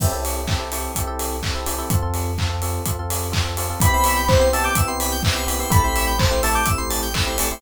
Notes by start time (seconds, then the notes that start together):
0.00 C2 C4 E4 G4 A4, kick, crash
0.12 C4 E4 G4 A4
0.25 open hi-hat
0.48 C4 E4 G4 A4, kick, clap
0.60 C4 E4 G4 A4
0.72 C4 E4 G4 A4, open hi-hat
0.95 C2 C4 E4 G4 A4, kick, closed hi-hat
1.07 C4 E4 G4 A4
1.19 open hi-hat
1.43 C4 E4 G4 A4, kick, clap
1.55 C4 E4 G4 A4
1.66 C4 E4 G4 A4, open hi-hat
1.78 C4 E4 G4 A4
1.90 F2 C4 F4 A4, kick, closed hi-hat
2.02 C4 F4 A4
2.14 open hi-hat
2.38 C4 F4 A4, kick, clap
2.49 C4 F4 A4
2.62 C4 F4 A4, open hi-hat
2.86 F2 C4 F4 A4, kick, closed hi-hat
2.99 C4 F4 A4
3.10 open hi-hat
3.32 C4 F4 A4, kick, clap
3.44 C4 F4 A4
3.57 C4 F4 A4, open hi-hat
3.70 C4 F4 A4
3.80 C2 B3 C4 E4 G4 B4 B5, kick, closed hi-hat
3.93 B3 C4 E4 G4 C5
4.04 E5, open hi-hat
4.16 G5
4.28 B3 C4 E4 G4 C5 B5, kick, clap
4.40 B3 C4 E4 G4 C6
4.53 B3 C4 E4 G4 A5 E6, open hi-hat
4.64 D6 G6
4.75 C2 B3 C4 E4 G4 E6, kick, closed hi-hat
4.87 B3 C4 E4 G4 C6
5.00 B5, open hi-hat
5.12 G5
5.23 B3 C4 E4 G4 E5, kick, clap
5.35 B3 C4 E4 G4 C5
5.47 B3 C4 E4 G4 B4, open hi-hat
5.59 B3 C4 E4 G4 C5
5.70 A1 A3 C4 E4 G4 A4 B5, kick, closed hi-hat
5.84 A3 C4 E4 G4 C5
5.95 E5, open hi-hat
6.07 G5
6.18 A3 C4 E4 G4 C5 A5, kick, clap
6.31 A3 C4 E4 G4 C6
6.43 A3 C4 E4 G4 A5 E6, open hi-hat
6.54 D6 G6
6.66 A1 A3 C4 E4 G4 E6, kick, closed hi-hat
6.78 A3 C4 E4 G4 C6
6.90 A5, open hi-hat
7.02 G5
7.14 A3 C4 E4 G4 E5, kick, clap
7.26 A3 C4 E4 G4 C5
7.38 A3 C4 E4 G4 A4, open hi-hat
7.50 A3 C4 E4 G4 C5